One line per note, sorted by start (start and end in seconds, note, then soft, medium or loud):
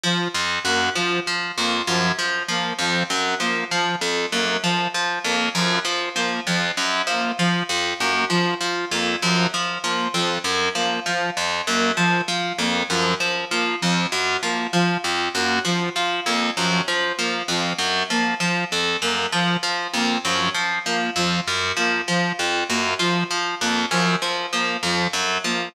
0.03 0.28 F3 medium
0.34 0.59 F2 medium
0.65 0.89 F#2 medium
0.65 0.90 A#3 medium
0.95 1.20 F3 medium
1.27 1.52 F3 medium
1.57 1.82 F2 medium
1.57 1.82 A#3 medium
1.87 2.12 F#2 medium
1.87 2.12 F3 medium
2.19 2.43 F3 medium
2.48 2.73 F3 medium
2.48 2.74 A#3 medium
2.79 3.03 F2 medium
2.79 3.04 F3 medium
3.10 3.35 F#2 medium
3.40 3.64 F3 medium
3.40 3.65 A#3 medium
3.71 3.96 F3 medium
4.01 4.26 F2 medium
4.32 4.57 F#2 medium
4.32 4.57 A#3 medium
4.63 4.88 F3 medium
4.94 5.19 F3 medium
5.24 5.49 F2 medium
5.24 5.49 A#3 medium
5.55 5.79 F#2 medium
5.55 5.79 F3 medium
5.85 6.09 F3 medium
6.16 6.40 F3 medium
6.16 6.40 A#3 medium
6.47 6.71 F2 medium
6.47 6.72 F3 medium
6.77 7.02 F#2 medium
7.07 7.31 F3 medium
7.07 7.32 A#3 medium
7.39 7.63 F3 medium
7.39 7.64 F3 medium
7.69 7.94 F2 medium
8.00 8.25 F#2 medium
8.00 8.24 A#3 medium
8.30 8.54 F3 medium
8.30 8.55 F3 medium
8.61 8.85 F3 medium
8.91 9.16 F2 medium
8.91 9.16 A#3 medium
9.22 9.47 F#2 medium
9.22 9.47 F3 medium
9.54 9.78 F3 medium
9.83 10.08 F3 medium
9.83 10.08 A#3 medium
10.14 10.39 F2 medium
10.14 10.38 F3 medium
10.44 10.69 F#2 medium
10.75 11.00 F3 medium
10.75 11.00 A#3 medium
11.06 11.30 F3 medium
11.37 11.61 F2 medium
11.67 11.92 F#2 medium
11.67 11.91 A#3 medium
11.97 12.21 F3 medium
11.97 12.22 F3 medium
12.28 12.53 F3 medium
12.58 12.83 F2 medium
12.58 12.83 A#3 medium
12.90 13.14 F#2 medium
12.90 13.14 F3 medium
13.20 13.45 F3 medium
13.51 13.76 F3 medium
13.51 13.75 A#3 medium
13.82 14.07 F2 medium
13.82 14.06 F3 medium
14.12 14.37 F#2 medium
14.43 14.67 F3 medium
14.43 14.67 A#3 medium
14.73 14.97 F3 medium
14.73 14.98 F3 medium
15.04 15.29 F2 medium
15.34 15.59 F#2 medium
15.34 15.59 A#3 medium
15.65 15.89 F3 medium
15.65 15.90 F3 medium
15.96 16.20 F3 medium
16.26 16.51 F2 medium
16.26 16.51 A#3 medium
16.57 16.82 F#2 medium
16.57 16.81 F3 medium
16.88 17.12 F3 medium
17.18 17.43 F3 medium
17.18 17.42 A#3 medium
17.48 17.73 F2 medium
17.48 17.74 F3 medium
17.78 18.03 F#2 medium
18.10 18.35 F3 medium
18.10 18.34 A#3 medium
18.40 18.65 F3 medium
18.72 18.97 F2 medium
19.02 19.26 F#2 medium
19.02 19.27 A#3 medium
19.32 19.57 F3 medium
19.63 19.87 F3 medium
19.93 20.18 F2 medium
19.93 20.18 A#3 medium
20.24 20.49 F#2 medium
20.24 20.49 F3 medium
20.54 20.79 F3 medium
20.85 21.10 F3 medium
20.85 21.10 A#3 medium
21.16 21.40 F2 medium
21.16 21.41 F3 medium
21.48 21.72 F#2 medium
21.77 22.01 F3 medium
21.77 22.02 A#3 medium
22.08 22.32 F3 medium
22.08 22.33 F3 medium
22.39 22.64 F2 medium
22.69 22.94 F#2 medium
22.69 22.94 A#3 medium
22.99 23.24 F3 medium
23.31 23.55 F3 medium
23.61 23.86 F2 medium
23.61 23.85 A#3 medium
23.91 24.16 F#2 medium
23.91 24.16 F3 medium
24.22 24.46 F3 medium
24.53 24.77 F3 medium
24.53 24.77 A#3 medium
24.83 25.07 F2 medium
24.83 25.08 F3 medium
25.13 25.38 F#2 medium
25.44 25.69 F3 medium
25.44 25.69 A#3 medium